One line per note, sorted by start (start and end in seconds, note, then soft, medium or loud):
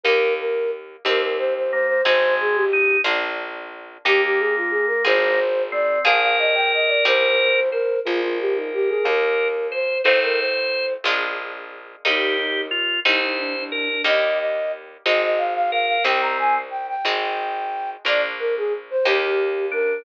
0.03 0.97 D#2 loud
0.03 1.03 A#3 medium
0.03 1.03 D#4 medium
0.03 1.03 G4 medium
0.03 0.34 A#4 medium
0.40 0.71 A#4 medium
1.05 1.97 D#2 loud
1.05 2.04 C4 loud
1.05 2.04 D#4 medium
1.05 2.04 G4 medium
1.05 1.21 A#4 medium
1.22 1.37 A#4 medium
1.38 1.53 C5 medium
1.56 1.71 C5 medium
1.72 2.01 A#3 medium
1.72 1.87 C5 medium
1.87 2.03 C5 medium
2.05 2.98 G#1 loud
2.05 2.65 G#3 loud
2.05 3.03 C4 medium
2.05 3.03 D#4 medium
2.05 3.03 G#4 medium
2.05 2.34 C5 medium
2.40 2.56 G#4 medium
2.55 2.97 G4 medium
2.73 3.01 D#4 medium
3.04 3.98 A#1 loud
3.04 4.02 A#3 medium
3.04 4.02 D4 loud
3.04 4.02 F4 medium
4.05 4.97 D#2 loud
4.05 5.40 A#3 loud
4.05 5.04 A#3 loud
4.05 5.04 D#4 loud
4.05 4.21 G4 medium
4.05 5.04 G4 medium
4.23 4.39 G4 medium
4.39 4.55 G#4 medium
4.57 4.72 F4 medium
4.70 4.86 G#4 medium
4.87 5.03 A#4 medium
5.05 5.98 G#1 loud
5.05 6.03 C4 medium
5.05 6.03 F4 medium
5.05 6.03 G#4 loud
5.05 5.63 C5 medium
5.72 6.04 C4 medium
5.72 5.99 D5 medium
6.05 6.98 A#1 loud
6.05 7.03 A#3 loud
6.05 7.03 D4 medium
6.05 7.03 F4 medium
6.05 7.03 G#4 medium
6.05 7.60 A#4 loud
6.05 6.20 F5 medium
6.22 6.37 F5 medium
6.39 6.55 D#5 medium
6.55 6.71 G5 medium
6.74 6.89 D#5 medium
6.87 7.03 D5 medium
7.05 7.97 C2 loud
7.05 8.03 C4 medium
7.05 8.03 D#4 medium
7.05 8.03 G4 loud
7.05 7.69 C5 medium
7.71 7.99 A#4 medium
7.71 8.00 C5 loud
8.05 8.99 A#1 loud
8.05 9.04 A#3 loud
8.05 9.04 D4 medium
8.05 8.21 F4 medium
8.05 9.04 F4 medium
8.05 9.04 G#4 loud
8.05 9.48 A#4 loud
8.22 8.38 F4 medium
8.40 8.56 G4 medium
8.55 8.71 D#4 medium
8.73 8.89 G4 medium
8.89 9.04 G#4 medium
9.05 9.97 D#2 loud
9.05 10.03 A#3 medium
9.05 10.03 D#4 medium
9.05 10.03 G4 medium
9.05 9.67 A#4 medium
9.72 9.98 C5 medium
9.72 10.01 C5 medium
10.03 10.97 A1 medium
10.03 11.03 A3 medium
10.03 11.03 C4 loud
10.03 11.03 D#4 medium
10.03 11.03 F4 medium
10.03 10.19 C5 medium
10.03 10.86 C5 medium
10.23 10.38 A#4 medium
10.38 10.93 C5 medium
11.04 11.96 A#1 loud
11.04 12.03 G#3 medium
11.04 12.03 A#3 medium
11.04 12.03 D4 medium
11.04 12.03 F4 medium
12.05 12.98 D#2 loud
12.05 13.03 G3 medium
12.05 13.03 A#3 medium
12.05 13.03 D#4 loud
12.05 12.37 D#4 medium
12.05 12.61 G4 loud
12.40 12.67 D#4 medium
12.71 13.00 F4 loud
13.05 13.98 C2 loud
13.05 14.03 G3 medium
13.05 14.03 C4 medium
13.05 14.03 D#4 loud
13.05 13.21 D#4 medium
13.05 13.64 C5 medium
13.21 13.37 D#4 medium
13.38 13.54 D4 medium
13.57 13.72 D4 medium
13.72 13.88 D4 medium
13.72 14.02 A#4 medium
13.90 14.05 D4 medium
14.04 14.97 D#2 loud
14.04 15.02 G3 medium
14.04 15.02 A#3 loud
14.04 15.02 D#4 medium
14.04 14.38 D#5 medium
14.39 14.72 D#5 medium
15.06 15.98 G#1 medium
15.06 16.04 G#3 medium
15.06 16.04 C4 medium
15.06 16.04 D#4 medium
15.06 15.22 D#5 medium
15.24 15.40 D#5 medium
15.38 15.53 F5 medium
15.55 15.71 F5 medium
15.72 16.04 A#4 medium
15.72 15.86 F5 medium
15.87 16.03 F5 medium
16.04 16.96 C2 loud
16.04 17.03 G3 medium
16.04 16.58 C4 loud
16.04 17.03 C4 medium
16.04 17.03 D#4 medium
16.04 16.21 G5 medium
16.21 16.37 A#5 medium
16.39 16.54 G#5 medium
16.71 16.86 G5 medium
16.88 17.90 G5 medium
17.05 17.97 G#1 loud
17.05 18.03 G#3 medium
17.05 18.03 C4 medium
17.05 18.03 D#4 loud
18.05 18.97 A#1 loud
18.05 19.04 A#3 medium
18.05 19.04 D4 loud
18.05 19.04 F4 medium
18.05 18.22 D5 medium
18.39 18.55 A#4 medium
18.57 18.73 G#4 medium
18.90 19.06 C5 medium
19.05 19.98 D#2 loud
19.05 20.03 A#3 medium
19.05 20.03 D#4 medium
19.05 20.03 G4 medium
19.05 19.65 G4 medium
19.72 20.03 D4 medium
19.72 20.02 A#4 medium